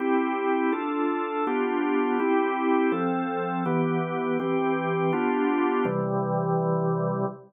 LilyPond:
\new Staff { \time 2/2 \key c \major \tempo 2 = 82 <c' e' g'>2 <d' f' a'>2 | <b d' f' g'>2 <c' e' g'>2 | <f c' a'>2 <e b g'>2 | <e c' g'>2 <b d' f' g'>2 |
<c e g>1 | }